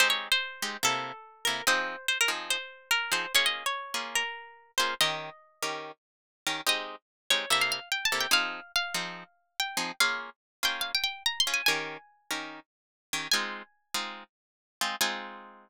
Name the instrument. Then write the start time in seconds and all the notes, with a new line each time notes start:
acoustic guitar (steel)
0.00 G#3 C4 D#4 G4 C5
0.10 C#5
0.32 C5
0.62 G#3 C4 D#4 G4
0.83 C3 A#3 E4 A4
1.45 C3 A#3 E4 A4 A#4
1.67 F3 C4 D#4 G#4 C5
2.08 C5
2.21 A#4
2.28 F3 C4 D#4 G#4
2.50 C5
2.91 A#4
3.12 F3 C4 D#4 G#4 C5
3.35 A#3 C#4 F4 G#4 C#5
3.46 D#5
3.66 C#5
3.94 A#3 C#4 F4 G#4
4.15 A#4
4.78 A#3 C#4 F4 G#4 C5
5.01 D#3 C#4 G4 A#4 D#5
5.63 D#3 C#4 G4 A#4
6.47 D#3 C#4 G4 A#4
6.67 G#3 C4 D#4 G4 D#5
7.30 G#3 C4 D#4 G4 C#5
7.50 C3 A#3 E4 A4 E5
7.61 F5
7.72 F5
7.92 G5
8.05 A5
8.12 C3 A#3 E4 A4
8.20 G5
8.31 F3 C4 D#4 G#4 F5
8.76 F5
8.94 F3 C4 D#4 G#4
9.60 G5
9.77 F3 C4 D#4 G#4
10.00 A#3 C#4 F4 G#4 F5
10.63 A#3 C#4 F4 G#4 G5
10.81 F5
10.95 G5
11.04 G5
11.26 A#5
11.40 C6
11.47 A#3 C#4 F4 G#4
11.54 G#5
11.66 D#3 C#4 G4 A#4 G#5
12.31 D#3 C#4 G4 A#4
13.13 D#3 C#4 G4 A#4
13.32 G#3 C4 D#4 F4 G#5
13.94 G#3 C4 D#4 F4
14.81 G#3 C4 D#4 F4
15.01 G#3 C4 D#4 F4 G#5